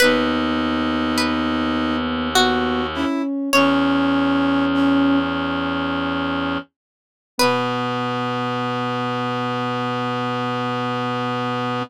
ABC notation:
X:1
M:3/4
L:1/16
Q:1/4=51
K:B
V:1 name="Pizzicato Strings"
B4 B4 F4 | "^rit." c10 z2 | B12 |]
V:2 name="Brass Section"
D8 F2 E z | "^rit." C4 C6 z2 | B,12 |]
V:3 name="Ocarina"
B,8 B,2 C2 | "^rit." C6 z6 | B,12 |]
V:4 name="Clarinet" clef=bass
D,,12 | "^rit." E,,10 z2 | B,,12 |]